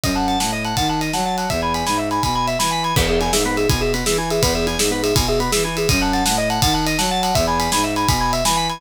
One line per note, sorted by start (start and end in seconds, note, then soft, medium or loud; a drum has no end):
0.04 0.36 F#2 medium
0.04 0.15 D#5 medium
0.04 kick loud
0.04 ride loud
0.16 0.27 F#5 medium
0.16 0.27 A5 medium
0.28 0.39 F#5 medium
0.28 0.39 A5 medium
0.28 ride medium
0.40 0.73 A2 medium
0.40 0.51 F#5 medium
0.40 0.51 A5 medium
0.40 snare loud
0.53 0.64 D#5 medium
0.65 0.76 F#5 medium
0.65 0.76 A5 medium
0.65 ride medium
0.77 1.10 D#3 medium
0.77 0.88 F#5 medium
0.77 0.87 A5 medium
0.77 kick loud
0.77 ride loud
0.89 1.00 F#5 medium
0.89 1.01 A5 medium
1.01 1.12 D#5 medium
1.01 ride medium
1.13 1.46 F#3 medium
1.13 1.25 F#5 medium
1.13 1.25 A5 medium
1.13 snare loud
1.25 1.37 F#5 medium
1.25 1.36 A5 medium
1.38 1.49 F#5 medium
1.38 1.49 A5 medium
1.38 ride medium
1.50 1.83 E2 medium
1.50 1.61 E5 medium
1.50 kick loud
1.50 ride loud
1.62 1.73 G#5 medium
1.62 1.74 B5 medium
1.74 1.86 G#5 medium
1.74 1.85 B5 medium
1.74 ride medium
1.86 2.19 G#2 medium
1.86 1.97 G#5 medium
1.86 1.98 B5 medium
1.86 snare loud
1.98 2.09 E5 medium
1.98 2.10 E5 medium
2.11 2.22 G#5 medium
2.11 2.22 B5 medium
2.11 ride medium
2.23 2.56 B2 medium
2.23 2.34 G#5 medium
2.23 2.34 B5 medium
2.23 kick loud
2.23 ride loud
2.35 2.46 G#5 medium
2.35 2.46 B5 medium
2.47 2.58 E5 medium
2.47 2.59 E5 medium
2.47 ride medium
2.59 2.93 E3 medium
2.59 2.71 G#5 medium
2.59 2.70 B5 medium
2.59 snare loud
2.71 2.82 G#5 medium
2.71 2.83 B5 medium
2.83 2.95 G#5 medium
2.83 2.94 B5 medium
2.83 ride medium
2.96 3.29 E2 loud
2.96 3.08 B3 loud
2.96 3.07 B4 loud
2.96 kick loud
2.96 crash loud
3.08 3.20 G#4 medium
3.08 3.19 E5 medium
3.21 3.32 E4 medium
3.21 3.32 G#5 medium
3.21 ride medium
3.33 3.66 G#2 medium
3.33 3.44 G#4 medium
3.33 3.44 E5 medium
3.33 snare loud
3.45 3.57 B3 medium
3.45 3.56 B4 loud
3.57 3.68 G#4 medium
3.57 3.68 E5 medium
3.57 ride medium
3.69 4.02 B2 medium
3.69 3.80 E4 medium
3.69 3.81 G#5 medium
3.69 kick loud
3.69 ride loud
3.81 3.92 G#4 medium
3.81 3.93 E5 medium
3.94 4.05 B3 medium
3.94 4.05 B4 medium
3.94 ride loud
4.06 4.39 E3 medium
4.06 4.17 G#4 medium
4.06 4.17 E5 loud
4.06 snare loud
4.18 4.29 E4 medium
4.18 4.29 G#5 medium
4.30 4.42 G#4 medium
4.30 4.42 E5 medium
4.30 ride loud
4.42 4.75 E2 medium
4.42 4.54 B3 loud
4.42 4.54 B4 loud
4.42 kick loud
4.42 ride loud
4.55 4.66 G#4 medium
4.55 4.66 E5 medium
4.67 4.78 E4 medium
4.67 4.78 G#5 medium
4.67 ride medium
4.79 5.12 G#2 medium
4.79 4.91 G#4 medium
4.79 4.90 E5 medium
4.79 snare loud
4.91 5.02 B3 medium
4.91 5.03 B4 medium
5.03 5.14 G#4 medium
5.03 5.15 E5 medium
5.03 ride loud
5.15 5.49 B2 medium
5.15 5.26 E4 medium
5.15 5.27 G#5 medium
5.15 kick loud
5.15 ride loud
5.28 5.40 G#4 medium
5.28 5.39 E5 medium
5.40 5.51 B3 medium
5.40 5.51 B4 loud
5.40 ride medium
5.52 5.86 E3 medium
5.52 5.63 G#4 medium
5.52 5.63 E5 loud
5.52 snare loud
5.64 5.75 E4 medium
5.64 5.75 G#5 medium
5.77 5.89 G#4 medium
5.77 5.88 E5 medium
5.77 ride loud
5.89 6.22 F#2 loud
5.89 6.00 D#5 loud
5.89 6.00 D#5 medium
5.89 kick loud
5.89 ride loud
6.01 6.12 F#5 medium
6.01 6.13 A5 medium
6.13 6.24 F#5 medium
6.13 6.24 A5 medium
6.13 ride medium
6.25 6.59 A2 medium
6.25 6.37 F#5 medium
6.25 6.36 A5 medium
6.25 snare loud
6.38 6.49 D#5 medium
6.50 6.61 F#5 medium
6.50 6.61 A5 medium
6.50 ride medium
6.62 6.95 D#3 medium
6.62 6.74 F#5 medium
6.62 6.73 A5 medium
6.62 kick loud
6.62 ride loud
6.74 6.85 F#5 medium
6.74 6.85 A5 medium
6.87 6.98 D#5 medium
6.87 ride loud
6.99 7.32 F#3 medium
6.99 7.10 F#5 loud
6.99 7.10 A5 medium
6.99 snare loud
7.11 7.22 F#5 medium
7.11 7.22 A5 medium
7.23 7.35 F#5 medium
7.23 7.34 A5 medium
7.23 ride loud
7.35 7.68 E2 loud
7.35 7.46 E5 medium
7.35 7.46 E5 loud
7.35 kick loud
7.35 ride loud
7.47 7.59 G#5 medium
7.47 7.58 B5 medium
7.59 7.70 G#5 medium
7.59 7.71 B5 medium
7.59 ride loud
7.72 8.05 G#2 medium
7.72 7.83 G#5 medium
7.72 7.84 B5 medium
7.72 snare loud
7.84 7.95 E5 medium
7.96 8.07 G#5 medium
7.96 8.07 B5 medium
7.96 ride medium
8.08 8.41 B2 medium
8.08 8.20 G#5 medium
8.08 8.20 B5 medium
8.08 kick loud
8.08 ride loud
8.20 8.31 G#5 medium
8.20 8.32 B5 medium
8.33 8.44 E5 medium
8.33 8.44 E5 loud
8.33 ride loud
8.45 8.78 E3 medium
8.45 8.56 G#5 medium
8.45 8.56 B5 medium
8.45 snare loud
8.57 8.68 G#5 medium
8.57 8.68 B5 medium
8.69 8.81 G#5 medium
8.69 8.80 B5 medium
8.69 ride medium